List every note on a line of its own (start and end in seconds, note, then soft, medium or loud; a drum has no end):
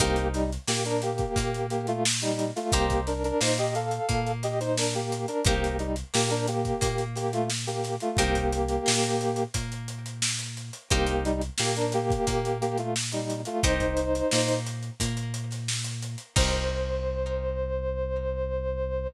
0.00 0.58 C2 loud
0.00 0.28 A#3 loud
0.00 0.41 D#4 loud
0.00 0.28 G4 loud
0.00 0.41 G4 loud
0.00 0.41 A#4 loud
0.00 0.41 C5 loud
0.00 kick medium
0.00 closed hi-hat medium
0.16 closed hi-hat medium
0.34 0.50 G3 loud
0.34 0.50 D#4 loud
0.34 snare soft
0.34 closed hi-hat medium
0.52 closed hi-hat medium
0.67 1.26 A#2 medium
0.67 1.25 A#3 medium
0.67 0.84 A#3 medium
0.67 0.84 G4 medium
0.67 snare medium
0.85 1.01 D4 loud
0.85 1.01 A#4 loud
0.85 closed hi-hat medium
1.02 1.66 A#3 medium
1.02 1.66 G4 loud
1.02 closed hi-hat medium
1.18 kick medium
1.18 closed hi-hat medium
1.36 2.52 A#2 medium
1.36 2.52 A#3 medium
1.36 kick medium
1.36 closed hi-hat medium
1.54 closed hi-hat medium
1.70 1.86 A#3 medium
1.70 1.86 G4 loud
1.70 closed hi-hat medium
1.87 2.04 A3 loud
1.87 2.04 F4 loud
1.87 closed hi-hat medium
2.05 snare loud
2.21 2.50 G3 loud
2.21 2.50 D#4 loud
2.21 snare soft
2.21 closed hi-hat medium
2.39 closed hi-hat medium
2.56 2.72 A3 medium
2.56 2.72 F4 loud
2.56 snare soft
2.56 closed hi-hat medium
2.72 3.32 C2 medium
2.72 3.01 A#3 loud
2.72 3.14 D#4 loud
2.72 3.01 G4 loud
2.72 3.14 G4 loud
2.72 3.14 A#4 loud
2.72 3.14 C5 loud
2.72 kick medium
2.72 closed hi-hat loud
2.90 kick medium
2.90 closed hi-hat medium
3.07 3.23 D4 medium
3.07 3.23 A#4 medium
3.07 snare soft
3.07 closed hi-hat medium
3.24 3.40 D4 loud
3.24 3.40 A#4 loud
3.24 closed hi-hat medium
3.41 3.99 A#2 medium
3.41 3.99 A#3 medium
3.41 3.57 D#4 medium
3.41 3.57 C5 loud
3.41 snare loud
3.58 3.74 G4 loud
3.58 3.74 D#5 loud
3.58 closed hi-hat medium
3.75 4.32 A4 medium
3.75 4.32 F5 medium
3.75 closed hi-hat medium
3.91 closed hi-hat medium
4.09 5.26 A#2 medium
4.09 5.25 A#3 medium
4.09 kick medium
4.09 closed hi-hat medium
4.26 closed hi-hat medium
4.43 4.60 G4 medium
4.43 4.60 D#5 loud
4.43 snare soft
4.43 closed hi-hat medium
4.60 4.77 D#4 medium
4.60 4.77 C5 loud
4.60 snare soft
4.60 closed hi-hat medium
4.77 4.93 D4 medium
4.77 4.93 A#4 loud
4.77 snare medium
4.93 5.26 A#3 medium
4.93 5.26 G4 medium
4.93 closed hi-hat medium
5.12 closed hi-hat medium
5.28 5.44 D4 medium
5.28 5.44 A#4 loud
5.28 closed hi-hat medium
5.44 6.03 C2 medium
5.44 5.77 A#3 loud
5.44 5.87 D#4 loud
5.44 5.77 G4 loud
5.44 5.87 G4 loud
5.44 5.87 A#4 loud
5.44 5.87 C5 loud
5.44 kick loud
5.44 closed hi-hat loud
5.64 closed hi-hat medium
5.79 5.96 G3 medium
5.79 5.96 D#4 medium
5.79 closed hi-hat medium
5.96 closed hi-hat medium
6.14 6.73 A#2 medium
6.14 6.30 A#3 loud
6.14 6.72 A#3 medium
6.14 6.30 G4 loud
6.14 snare loud
6.30 6.47 D4 medium
6.30 6.47 A#4 loud
6.30 closed hi-hat medium
6.47 7.04 A#3 medium
6.47 7.04 G4 loud
6.47 closed hi-hat medium
6.65 kick medium
6.65 closed hi-hat medium
6.81 7.97 A#2 medium
6.81 7.97 A#3 medium
6.81 kick medium
6.81 closed hi-hat loud
6.98 closed hi-hat medium
7.15 7.32 A#3 medium
7.15 7.32 G4 loud
7.15 snare soft
7.15 closed hi-hat medium
7.33 7.49 A3 loud
7.33 7.49 F4 loud
7.33 closed hi-hat medium
7.50 snare medium
7.67 7.96 A#3 medium
7.67 7.96 G4 medium
7.67 snare soft
7.67 closed hi-hat medium
7.84 snare soft
7.84 closed hi-hat medium
8.00 8.17 A3 medium
8.00 8.17 F4 loud
8.00 closed hi-hat medium
8.17 8.78 C2 loud
8.17 9.44 A#3 loud
8.17 8.59 D#4 loud
8.17 9.44 G4 loud
8.17 8.59 G4 loud
8.17 8.59 A#4 loud
8.17 8.59 C5 loud
8.17 kick loud
8.17 closed hi-hat medium
8.35 kick medium
8.35 closed hi-hat medium
8.52 closed hi-hat medium
8.68 closed hi-hat medium
8.86 9.46 A#2 medium
8.86 9.44 A#3 medium
8.86 snare loud
9.03 closed hi-hat medium
9.21 closed hi-hat medium
9.36 closed hi-hat medium
9.54 10.71 A#2 medium
9.54 10.70 A#3 medium
9.54 kick medium
9.54 closed hi-hat loud
9.72 closed hi-hat medium
9.88 closed hi-hat medium
10.06 closed hi-hat medium
10.22 snare loud
10.39 closed hi-hat medium
10.57 closed hi-hat medium
10.73 closed hi-hat medium
10.90 11.50 C2 medium
10.90 11.23 A#3 loud
10.90 11.32 D#4 loud
10.90 11.23 G4 loud
10.90 11.32 G4 loud
10.90 11.32 A#4 loud
10.90 11.32 C5 loud
10.90 kick loud
10.90 closed hi-hat medium
11.07 closed hi-hat medium
11.25 11.41 G3 loud
11.25 11.41 D#4 loud
11.25 closed hi-hat medium
11.41 closed hi-hat medium
11.58 12.17 A#2 medium
11.58 11.75 A#3 medium
11.58 12.17 A#3 medium
11.58 11.75 G4 loud
11.58 snare loud
11.76 11.92 D4 medium
11.76 11.92 A#4 loud
11.76 closed hi-hat medium
11.92 12.57 A#3 loud
11.92 12.57 G4 loud
11.92 snare soft
11.92 closed hi-hat medium
12.10 kick medium
12.10 closed hi-hat medium
12.27 13.44 A#2 medium
12.27 13.43 A#3 medium
12.27 kick medium
12.27 closed hi-hat medium
12.45 closed hi-hat medium
12.61 12.77 A#3 loud
12.61 12.77 G4 loud
12.61 closed hi-hat medium
12.78 12.94 A3 medium
12.78 12.94 F4 medium
12.78 closed hi-hat medium
12.96 snare medium
13.12 13.41 G3 medium
13.12 13.41 D#4 medium
13.12 closed hi-hat medium
13.30 closed hi-hat medium
13.45 13.63 A3 medium
13.45 13.63 F4 loud
13.45 closed hi-hat medium
13.63 14.22 C2 medium
13.63 14.05 D#4 loud
13.63 14.59 D#4 loud
13.63 14.05 G4 loud
13.63 14.05 A#4 loud
13.63 14.59 C5 loud
13.63 14.05 C5 loud
13.63 kick loud
13.63 closed hi-hat loud
13.80 kick medium
13.80 closed hi-hat medium
13.97 closed hi-hat medium
14.15 closed hi-hat medium
14.31 14.90 A#2 medium
14.31 14.91 A#3 medium
14.31 snare loud
14.48 closed hi-hat medium
14.66 closed hi-hat medium
14.83 closed hi-hat medium
15.00 16.16 A#2 medium
15.00 16.16 A#3 medium
15.00 kick medium
15.00 closed hi-hat loud
15.17 closed hi-hat medium
15.34 closed hi-hat medium
15.51 snare soft
15.51 closed hi-hat medium
15.68 snare medium
15.84 snare soft
15.84 closed hi-hat medium
16.02 closed hi-hat medium
16.18 closed hi-hat medium
16.36 19.07 C2 loud
16.36 19.07 D#4 loud
16.36 19.07 G4 loud
16.36 19.07 A#4 loud
16.36 19.07 C5 loud
16.36 19.07 C5 medium
16.36 kick loud
16.36 crash loud